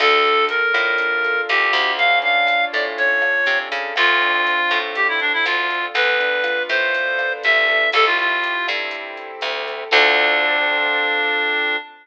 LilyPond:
<<
  \new Staff \with { instrumentName = "Clarinet" } { \time 4/4 \key d \minor \tempo 4 = 121 a'4 bes'2 g'4 | f''8 f''4 d''16 r16 cis''4. r8 | f'2 g'16 e'16 d'16 e'16 f'4 | b'4. c''4. e''4 |
a'16 f'16 f'4 r2 r8 | d'1 | }
  \new Staff \with { instrumentName = "Acoustic Grand Piano" } { \time 4/4 \key d \minor d'8 a'8 d'8 f'8 d'8 a'8 f'8 d'8 | cis'8 d'8 f'8 a'8 cis'8 d'8 f'8 a'8 | c'8 d'8 f'8 a'8 c'8 d'8 f'8 a'8 | b8 d'8 f'8 a'8 b8 d'8 f'8 a'8 |
c'8 e'8 g'8 a'8 c'8 e'8 g'8 a'8 | <c' d' f' a'>1 | }
  \new Staff \with { instrumentName = "Electric Bass (finger)" } { \clef bass \time 4/4 \key d \minor d,4. a,4. d,8 d,8~ | d,4. a,4. c8 cis8 | d,4. a,4. d,4 | d,4. a,4. c,4 |
c,4. g,4. d,4 | d,1 | }
  \new DrumStaff \with { instrumentName = "Drums" } \drummode { \time 4/4 <cymc bd ss>8 hh8 hh8 <hh bd ss>8 <hh bd>8 hh8 <hh ss>8 <hh bd>8 | <hh bd>8 hh8 <hh ss>8 <hh bd>8 <hh bd>8 <hh ss>8 hh8 <hh bd>8 | <hh bd ss>8 hh8 hh8 <hh bd ss>8 <hh bd>8 hh8 <hh ss>8 <hh bd>8 | <hh bd>8 hh8 <hh ss>8 <hh bd>8 <hh bd>8 <hh ss>8 hh8 <hh bd>8 |
<hh bd ss>8 hh8 hh8 <hh bd ss>8 <hh bd>8 hh8 <hh ss>8 <hh bd>8 | <cymc bd>4 r4 r4 r4 | }
>>